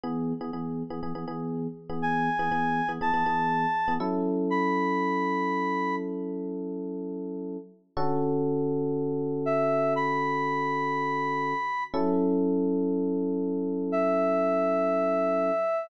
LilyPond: <<
  \new Staff \with { instrumentName = "Lead 1 (square)" } { \time 4/4 \key fis \minor \tempo 4 = 121 r1 | gis''2 a''2 | r4 b''2. | r1 |
r2. e''4 | b''1 | r1 | e''1 | }
  \new Staff \with { instrumentName = "Electric Piano 1" } { \time 4/4 \key fis \minor <e b gis'>8. <e b gis'>16 <e b gis'>8. <e b gis'>16 <e b gis'>16 <e b gis'>16 <e b gis'>4~ <e b gis'>16 <e b gis'>16~ | <e b gis'>8. <e b gis'>16 <e b gis'>8. <e b gis'>16 <e b gis'>16 <e b gis'>16 <e b gis'>4~ <e b gis'>16 <e b gis'>16 | <fis cis' e' a'>1~ | <fis cis' e' a'>1 |
<d cis' fis' a'>1~ | <d cis' fis' a'>1 | <fis cis' e' a'>1~ | <fis cis' e' a'>1 | }
>>